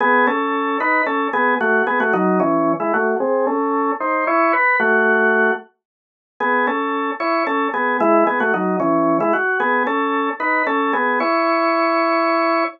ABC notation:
X:1
M:6/8
L:1/16
Q:3/8=75
K:C#m
V:1 name="Drawbar Organ"
[B,G]2 [CA]4 [DB]2 [CA]2 [B,G]2 | [A,F]2 [B,G] [A,F] [F,D]2 [E,C]3 [G,E] [A,F]2 | [^B,G]2 [CA]4 [D^B]2 [Ec]2 =B2 | [A,F]6 z6 |
[B,G]2 [CA]4 [Ec]2 [CA]2 [B,G]2 | [G,E]2 [B,G] [A,F] [F,D]2 [E,C]3 [G,E] F2 | [B,G]2 [CA]4 [DB]2 [CA]2 [B,G]2 | [Ec]12 |]